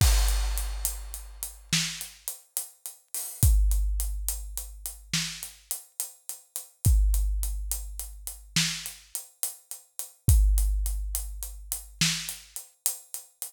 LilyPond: \new DrumStaff \drummode { \time 12/8 \tempo 4. = 70 <cymc bd>8 hh8 hh8 hh8 hh8 hh8 sn8 hh8 hh8 hh8 hh8 hho8 | <hh bd>8 hh8 hh8 hh8 hh8 hh8 sn8 hh8 hh8 hh8 hh8 hh8 | <hh bd>8 hh8 hh8 hh8 hh8 hh8 sn8 hh8 hh8 hh8 hh8 hh8 | <hh bd>8 hh8 hh8 hh8 hh8 hh8 sn8 hh8 hh8 hh8 hh8 hh8 | }